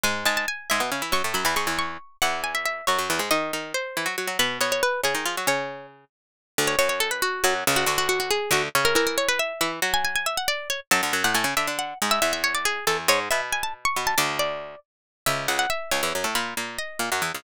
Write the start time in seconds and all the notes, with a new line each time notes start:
0.04 G#2 G#3 G#5
0.25 G#2 G#3 A5
0.37 A5
0.48 G#5
0.70 G#2 G#3 E5
0.80 B2 B3
0.92 C#3 C#4
1.02 E3 E4
1.12 F#2 F#3 C#6
1.24 A2 A3
1.34 F#2 F#3 B5
1.45 E2 E3 B5
1.56 G#2 G#3 C#6
1.67 E2 E3
1.79 C#6
2.22 E2 E3 F#5
2.44 G#5
2.55 E5
2.65 E5
2.87 F#2 F#3 C#5
2.99 F#2 F#3
3.10 E2 E3
3.19 G#2 G#3
3.31 D#3 D#4 D#5
3.53 D#3 D#4
3.74 C5
3.97 E3 E4
4.06 F#3 F#4
4.18 F#3 F#4
4.28 F#3 F#4
4.39 B2 B3 B4
4.61 B2 B3 C#5
4.72 C#5
4.83 B4
5.04 C#3 C#4 G#4
5.15 D#3 D#4
5.26 F3 F4
5.37 F#3 F#4
5.47 C#3 C#4 C#5
6.58 D2 D3
6.67 C#5
6.79 F#2 F#3 C#5
6.89 C#5
7.00 A4
7.11 B4
7.22 F#4
7.44 F#2 F#3 F#4
7.67 C#2 C#3
7.76 F#4
7.86 D2 D3 F#4
7.98 F#4
8.09 F#4
8.20 F#4
8.31 G#4
8.51 D2 D3 F#4
8.75 C#3 C#4
8.85 A#4
8.95 E3 E4 A#4
9.07 A#4
9.18 C#5
9.29 B4
9.39 E5
9.61 E3 E4 E5
9.82 F#3 F#4
9.94 G#5
10.05 G#5
10.16 G#5
10.26 E5
10.37 F#5
10.48 D5
10.70 C#5
10.91 F#2 F#3 A5
11.03 D2 D3
11.13 F#2 F#3
11.24 A2 A3 F#5
11.35 A2 A3 G#5
11.44 C#3 C#4
11.57 D3 D4 E5
11.67 D3 D4
11.79 F#5
12.02 G#2 G#3
12.11 E5
12.22 E2 E3 E5
12.33 E5
12.44 C#5
12.55 D5
12.65 G#4
12.87 E2 E3 A4
13.08 G#2 G#3 C#5
13.31 B2 B3 E5
13.53 G#5
13.63 A5
13.85 C#6
13.96 B2 B3
14.07 A5
14.18 D2 D3 D5
14.39 D5
15.26 C#2 C#3 E5
15.48 C#2 C#3 F#5
15.59 F#5
15.70 E5
15.91 C#2 C#3 C#5
16.03 E2 E3
16.15 F#2 F#3
16.24 A2 A3
16.35 A#2 A#3 B5
16.57 A#2 A#3
16.79 D#5
16.99 A#2 A#3
17.12 F#2 F#3
17.22 E2 E3
17.35 C#2 C#3